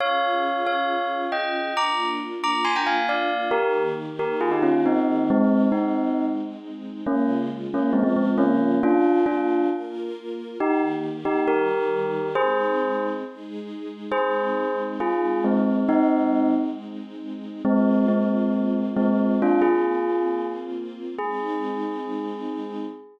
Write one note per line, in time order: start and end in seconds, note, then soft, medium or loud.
0.00 1.75 C#4 medium
0.00 1.75 F4 medium
0.00 1.75 G#4 medium
0.00 0.65 C#5 loud
0.00 0.65 F5 loud
0.67 1.21 C#5 medium
0.67 1.21 F5 medium
1.32 1.74 D#5 medium
1.32 1.74 G5 medium
1.76 3.51 A#3 medium
1.76 3.51 D4 medium
1.76 3.51 F4 medium
1.76 2.08 A#5 medium
1.76 2.08 D6 loud
2.44 2.65 A#5 medium
2.44 2.65 D6 loud
2.65 2.75 G#5 medium
2.65 2.75 C6 medium
2.76 2.86 G5 medium
2.76 2.86 A#5 medium
2.86 3.07 F5 medium
2.86 3.07 G#5 medium
3.09 3.49 D5 medium
3.09 3.49 F5 medium
3.51 5.29 D#3 loud
3.51 5.29 A#3 medium
3.51 3.83 G4 loud
3.51 5.29 G4 medium
3.51 3.83 A#4 loud
4.19 4.38 G4 medium
4.19 4.38 A#4 medium
4.41 4.51 F4 medium
4.41 4.51 G#4 loud
4.51 4.62 D#4 medium
4.51 4.62 G4 medium
4.62 4.81 C#4 medium
4.62 4.81 F4 medium
4.86 5.23 C4 medium
4.86 5.23 D#4 loud
5.30 5.66 G#3 loud
5.30 7.05 G#3 medium
5.30 5.66 C4 loud
5.30 7.05 C4 medium
5.30 7.05 D#4 medium
5.72 6.26 C4 medium
5.72 6.26 D#4 medium
7.05 7.93 C#3 medium
7.05 7.93 G#3 medium
7.05 7.36 A#3 medium
7.05 7.36 C#4 loud
7.05 7.93 F4 medium
7.74 7.92 A#3 medium
7.74 7.92 C#4 loud
7.93 8.81 C#3 medium
7.93 8.81 F3 medium
7.93 8.03 G#3 medium
7.93 8.03 C4 medium
7.93 8.81 F4 medium
8.03 8.14 G#3 medium
8.03 8.14 C4 loud
8.16 8.35 G#3 medium
8.16 8.35 C4 medium
8.38 8.79 A#3 loud
8.38 8.79 C#4 loud
8.82 9.70 A#3 medium
8.82 9.70 D4 medium
8.82 9.22 D4 loud
8.82 9.70 F4 medium
8.82 9.22 F4 loud
9.26 9.66 D4 medium
9.26 9.66 F4 loud
9.70 10.58 A#3 medium
9.70 10.58 F4 medium
9.70 10.58 A#4 medium
10.59 11.46 D#3 medium
10.59 11.46 A#3 medium
10.59 10.82 D#4 loud
10.59 11.46 G4 medium
10.59 10.82 G4 loud
11.25 11.44 D#4 medium
11.25 11.44 G4 loud
11.48 12.35 D#3 medium
11.48 12.35 G3 medium
11.48 12.27 G4 medium
11.48 12.35 G4 medium
11.48 12.27 A#4 loud
12.35 13.23 G#3 medium
12.35 13.23 C4 medium
12.35 13.23 D#4 medium
12.35 13.06 G#4 loud
12.35 13.06 C5 loud
13.24 14.11 G#3 medium
13.24 14.11 D#4 medium
13.24 14.11 G#4 medium
14.11 17.62 G#3 medium
14.11 17.62 C4 medium
14.11 17.62 D#4 medium
14.11 14.82 G#4 loud
14.11 14.82 C5 loud
15.00 15.40 F4 medium
15.00 15.40 G#4 medium
15.44 15.83 G#3 medium
15.44 15.83 C4 loud
15.89 16.50 C4 loud
15.89 16.50 D#4 loud
17.65 18.05 G#3 loud
17.65 21.15 A#3 medium
17.65 18.05 C4 loud
17.65 21.15 C4 medium
17.65 21.15 F4 medium
18.08 18.83 G#3 medium
18.08 18.83 C4 medium
18.97 19.36 G#3 medium
18.97 19.36 C4 loud
19.42 19.61 D4 loud
19.42 19.61 F4 loud
19.62 20.47 F4 medium
19.62 20.47 G#4 medium
21.18 22.85 G#3 medium
21.18 22.85 C4 medium
21.18 22.85 D#4 loud
21.18 22.86 G#4 loud